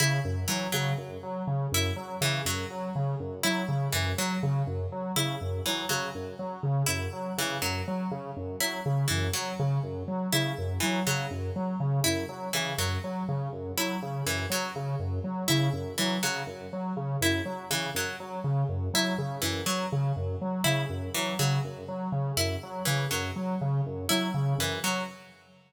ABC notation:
X:1
M:6/8
L:1/8
Q:3/8=81
K:none
V:1 name="Lead 1 (square)" clef=bass
_D, _G,, _G, D, G,, G, | _D, _G,, _G, D, G,, G, | _D, _G,, _G, D, G,, G, | _D, _G,, _G, D, G,, G, |
_D, _G,, _G, D, G,, G, | _D, _G,, _G, D, G,, G, | _D, _G,, _G, D, G,, G, | _D, _G,, _G, D, G,, G, |
_D, _G,, _G, D, G,, G, | _D, _G,, _G, D, G,, G, | _D, _G,, _G, D, G,, G, | _D, _G,, _G, D, G,, G, |
_D, _G,, _G, D, G,, G, | _D, _G,, _G, D, G,, G, | _D, _G,, _G, D, G,, G, | _D, _G,, _G, D, G,, G, |
_D, _G,, _G, D, G,, G, |]
V:2 name="Harpsichord"
E z E, _G, z2 | z E z E, _G, z | z2 E z E, _G, | z3 E z E, |
_G, z3 E z | E, _G, z3 E | z E, _G, z3 | E z E, _G, z2 |
z E z E, _G, z | z2 E z E, _G, | z3 E z E, | _G, z3 E z |
E, _G, z3 E | z E, _G, z3 | E z E, _G, z2 | z E z E, _G, z |
z2 E z E, _G, |]